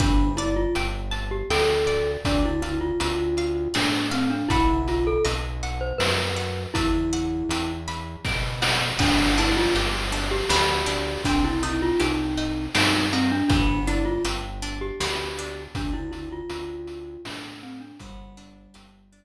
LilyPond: <<
  \new Staff \with { instrumentName = "Glockenspiel" } { \time 3/4 \key g \mixolydian \tempo 4 = 80 d'8 e'16 f'16 r8. g'16 a'4 | d'16 e'16 e'16 f'16 f'4 d'8 c'16 d'16 | e'8 f'16 a'16 r8. c''16 b'4 | e'4. r4. |
d'8 e'16 f'16 r8. g'16 g'4 | d'16 e'16 e'16 f'16 ees'4 ees'8 c'16 d'16 | d'8 e'16 f'16 r8. g'16 g'4 | d'16 e'16 e'16 f'16 f'4 d'8 c'16 d'16 |
g2~ g8 r8 | }
  \new Staff \with { instrumentName = "Pizzicato Strings" } { \time 3/4 \key g \mixolydian b'8 d''8 g''8 a''8 g''8 d''8 | d''8 f''8 a''8 f''8 d''8 f''8 | <e'' fis'' b''>4 dis''8 fis''8 b''8 fis''8 | e''8 fis''8 g''8 b''8 g''8 fis''8 |
b8 d'8 g'8 d'8 b8 d'8 | c'8 ees'8 g'8 ees'8 c'8 ees'8 | b8 d'8 g'8 d'8 b8 d'8 | r2. |
b8 d'8 g'8 d'8 r4 | }
  \new Staff \with { instrumentName = "Synth Bass 1" } { \clef bass \time 3/4 \key g \mixolydian g,,4 g,,4 d,4 | d,4 d,4 a,4 | b,,4 b,,4 fis,4 | e,4 e,4 b,4 |
g,,4 g,,4 d,4 | c,4 c,4 g,4 | g,,4 g,,4 d,4 | d,4 d,4 a,4 |
g,,4 g,,4 r4 | }
  \new DrumStaff \with { instrumentName = "Drums" } \drummode { \time 3/4 <hh bd>8 hh8 hh8 hh8 sn8 hh8 | <hh bd>8 hh8 hh8 hh8 sn8 hh8 | <hh bd>8 hh8 hh8 hh8 sn8 hh8 | <hh bd>8 hh8 hh8 hh8 <bd sn>8 sn8 |
<cymc bd>8 hh8 hh8 hh8 sn8 hh8 | <hh bd>8 hh8 hh8 hh8 sn8 hh8 | <hh bd>8 hh8 hh8 hh8 sn8 hh8 | <hh bd>8 hh8 hh8 hh8 sn8 hh8 |
<hh bd>8 hh8 hh8 hh8 r4 | }
>>